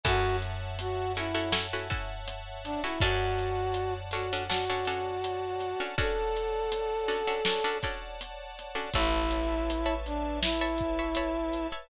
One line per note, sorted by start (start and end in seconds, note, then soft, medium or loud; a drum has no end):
0.04 2.78 F#2 medium
0.04 0.64 C#4 loud
0.04 0.64 E4 loud
0.04 0.64 F#4 loud
0.04 0.36 F#4 loud
0.04 0.64 A4 loud
0.04 2.97 C#5 loud
0.04 2.97 E5 loud
0.04 2.97 F#5 loud
0.04 2.97 A5 medium
0.04 kick loud
0.04 closed hi-hat loud
0.42 closed hi-hat medium
0.79 1.12 F#4 loud
0.79 closed hi-hat loud
1.16 1.32 C#4 medium
1.16 1.52 E4 loud
1.16 1.32 E4 loud
1.16 1.32 F#4 medium
1.16 1.32 A4 loud
1.16 closed hi-hat medium
1.35 1.49 C#4 loud
1.35 1.49 E4 loud
1.35 1.49 F#4 loud
1.35 1.49 A4 medium
1.52 1.67 C#4 medium
1.52 1.67 E4 loud
1.52 1.67 F#4 medium
1.52 1.67 A4 loud
1.52 snare loud
1.73 1.88 C#4 medium
1.73 1.88 E4 medium
1.73 1.88 F#4 loud
1.73 1.88 A4 loud
1.90 2.49 C#4 loud
1.90 2.49 E4 loud
1.90 2.49 F#4 medium
1.90 2.49 A4 medium
1.90 kick loud
1.90 closed hi-hat medium
2.28 closed hi-hat loud
2.64 2.82 D4 loud
2.64 closed hi-hat medium
2.84 2.99 C#4 loud
2.84 3.01 E4 medium
2.84 2.99 E4 loud
2.84 2.99 F#4 loud
2.84 2.99 A4 medium
3.00 5.75 F#2 medium
3.00 3.61 C#4 loud
3.00 3.61 D4 loud
3.00 3.94 F#4 loud
3.00 3.61 F#4 loud
3.00 3.61 A4 loud
3.00 5.96 C#5 medium
3.00 5.96 D5 medium
3.00 5.96 F#5 medium
3.00 5.96 A5 loud
3.00 kick loud
3.00 closed hi-hat loud
3.39 closed hi-hat medium
3.74 closed hi-hat loud
4.11 4.28 C#4 loud
4.11 4.28 D4 loud
4.11 4.28 F#4 medium
4.11 4.43 F#4 loud
4.11 4.28 A4 loud
4.11 closed hi-hat medium
4.33 4.48 C#4 loud
4.33 4.48 D4 loud
4.33 4.48 F#4 loud
4.33 4.48 A4 loud
4.50 4.65 C#4 medium
4.50 4.65 D4 medium
4.50 4.65 F#4 loud
4.50 5.83 F#4 loud
4.50 4.65 A4 loud
4.50 snare loud
4.70 4.84 C#4 loud
4.70 4.84 D4 medium
4.70 4.84 F#4 loud
4.70 4.84 A4 medium
4.85 5.47 C#4 loud
4.85 5.47 D4 loud
4.85 5.47 F#4 medium
4.85 5.47 A4 loud
4.85 closed hi-hat medium
5.24 closed hi-hat loud
5.60 closed hi-hat medium
5.80 5.95 C#4 loud
5.80 5.95 D4 medium
5.80 5.95 F#4 medium
5.80 5.95 A4 loud
5.98 6.57 C#4 loud
5.98 6.57 D4 loud
5.98 6.57 F#4 loud
5.98 6.57 A4 loud
5.98 7.77 A4 loud
5.98 8.92 C#5 loud
5.98 8.92 D5 loud
5.98 8.92 F#5 medium
5.98 8.92 A5 loud
5.98 kick loud
5.98 closed hi-hat loud
6.37 closed hi-hat medium
6.72 closed hi-hat loud
7.08 7.23 C#4 medium
7.08 7.23 D4 medium
7.08 7.23 F#4 loud
7.08 7.23 A4 loud
7.08 closed hi-hat medium
7.27 7.42 C#4 loud
7.27 7.42 D4 loud
7.27 7.42 F#4 loud
7.27 7.42 A4 medium
7.45 7.61 C#4 medium
7.45 7.61 D4 medium
7.45 7.61 F#4 medium
7.45 7.61 A4 loud
7.45 snare loud
7.64 7.79 C#4 loud
7.64 7.79 D4 loud
7.64 7.79 F#4 medium
7.64 7.79 A4 medium
7.83 8.43 C#4 loud
7.83 8.43 D4 loud
7.83 8.43 F#4 loud
7.83 8.43 A4 medium
7.83 kick medium
7.83 closed hi-hat medium
8.21 closed hi-hat loud
8.59 closed hi-hat medium
8.75 8.90 C#4 medium
8.75 8.90 D4 loud
8.75 8.90 F#4 medium
8.75 8.90 A4 loud
8.94 11.67 A1 loud
8.94 9.94 E4 loud
8.94 11.87 B4 loud
8.94 11.87 C#5 loud
8.94 9.55 C#5 loud
8.94 11.87 E5 loud
8.94 9.55 E5 loud
8.94 11.87 A5 medium
8.94 9.55 A5 loud
8.94 9.55 B5 loud
8.94 kick loud
8.94 closed hi-hat loud
9.31 closed hi-hat medium
9.70 closed hi-hat loud
9.86 10.45 C#5 loud
9.86 10.45 E5 medium
9.86 10.45 A5 loud
9.86 10.45 B5 medium
10.06 10.39 D4 loud
10.06 closed hi-hat medium
10.42 11.67 E4 loud
10.42 snare loud
10.61 10.91 C#5 loud
10.61 10.91 E5 loud
10.61 10.91 A5 medium
10.61 10.91 B5 medium
10.78 kick medium
10.78 closed hi-hat medium
10.99 11.14 C#5 loud
10.99 11.14 E5 medium
10.99 11.14 A5 loud
10.99 11.14 B5 medium
11.15 11.61 C#5 loud
11.15 11.61 E5 medium
11.15 11.61 A5 medium
11.15 11.61 B5 loud
11.15 closed hi-hat loud
11.53 closed hi-hat medium
11.72 11.87 C#5 medium
11.72 11.87 E5 medium
11.72 11.87 A5 medium
11.72 11.87 B5 medium